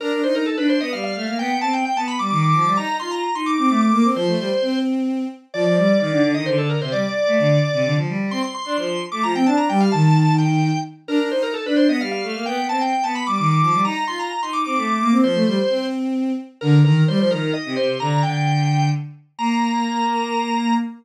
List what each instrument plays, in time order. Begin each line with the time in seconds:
0.00 violin D4, drawbar organ A#4
0.12 violin D4
0.23 violin D#4, drawbar organ C5
0.35 drawbar organ A#4
0.46 drawbar organ A4
0.57 violin D4, drawbar organ B4
0.69 drawbar organ C5
0.80 violin B3, drawbar organ D#5
0.92 violin G3, drawbar organ F5
1.04 drawbar organ F5
1.15 violin A3
1.27 violin A#3
1.39 violin B3, drawbar organ G5
1.50 violin B3
1.61 violin C4, drawbar organ A5
1.73 drawbar organ G5
1.85 drawbar organ G5
1.96 violin B3, drawbar organ A5
2.07 drawbar organ B5
2.19 violin G3, drawbar organ D6
2.31 violin D#3, drawbar organ D6
2.43 drawbar organ D6
2.54 violin F3
2.65 violin G3
2.77 violin D#4, drawbar organ A#5
2.88 violin D#4
3.00 violin F4, drawbar organ C6
3.11 drawbar organ A#5
3.23 drawbar organ A#5
3.35 violin D#4, drawbar organ C6
3.46 drawbar organ D6
3.58 violin C4, drawbar organ D6
3.69 violin A3, drawbar organ D6
3.81 drawbar organ D6
3.92 violin A#3
4.04 violin C4
4.15 violin F3, drawbar organ C5
4.27 violin A3
4.38 violin G3
4.62 violin C4
5.54 violin F3, drawbar organ D5
5.65 violin F3, drawbar organ D5
5.76 violin G3, drawbar organ D5
5.88 drawbar organ D5
6.00 violin D#3, drawbar organ D5
6.12 violin D3
6.23 violin D3
6.34 violin D#3, drawbar organ D#5
6.46 violin D3, drawbar organ C5
6.58 drawbar organ A4
6.70 drawbar organ A#4
6.81 violin C3, drawbar organ C5
6.92 violin G3, drawbar organ D5
7.27 violin A3
7.38 violin D3
7.73 violin C3
7.85 violin D3
7.96 violin F3
8.08 violin G3
8.31 violin C4, drawbar organ C6
8.42 drawbar organ C6
8.54 drawbar organ C6
8.65 violin D4, drawbar organ C6
8.77 violin F3, drawbar organ C6
9.12 violin A3, drawbar organ D6
9.23 violin F3, drawbar organ A#5
9.35 violin C4, drawbar organ G5
9.46 violin D4, drawbar organ A5
9.57 drawbar organ A#5
9.69 violin G3, drawbar organ G5
9.80 drawbar organ F5
9.92 violin D#3, drawbar organ A5
10.38 drawbar organ G5
11.08 violin D4, drawbar organ A#4
11.19 violin D4
11.31 violin D#4, drawbar organ C5
11.43 drawbar organ A#4
11.54 drawbar organ A4
11.65 violin D4, drawbar organ B4
11.76 drawbar organ C5
11.88 violin B3, drawbar organ D#5
12.00 violin G3, drawbar organ F5
12.11 drawbar organ F5
12.23 violin A3
12.35 violin A#3
12.46 violin B3, drawbar organ G5
12.58 violin B3
12.69 violin C4, drawbar organ A5
12.81 drawbar organ G5
12.93 drawbar organ G5
13.04 violin B3, drawbar organ A5
13.15 drawbar organ B5
13.27 violin G3, drawbar organ D6
13.38 violin D#3, drawbar organ D6
13.50 drawbar organ D6
13.62 violin F3
13.73 violin G3
13.85 violin D#4, drawbar organ A#5
13.96 violin D#4
14.07 violin F4, drawbar organ C6
14.19 drawbar organ A#5
14.31 drawbar organ A#5
14.42 violin D#4, drawbar organ C6
14.53 drawbar organ D6
14.65 violin C4, drawbar organ D6
14.76 violin A3, drawbar organ D6
14.88 drawbar organ D6
15.00 violin A#3
15.11 violin C4
15.23 violin F3, drawbar organ C5
15.35 violin A3
15.46 violin G3
15.69 violin C4
16.61 violin D3, drawbar organ A#4
16.84 violin D#3, drawbar organ A#4
17.08 violin G3, drawbar organ C5
17.19 violin F3, drawbar organ C5
17.31 violin D#3, drawbar organ A#4
17.53 drawbar organ D#5
17.65 violin C3
17.76 violin C3, drawbar organ C5
18.00 violin D3, drawbar organ A#5
18.23 violin D3, drawbar organ G5
19.38 violin A#3, drawbar organ A#5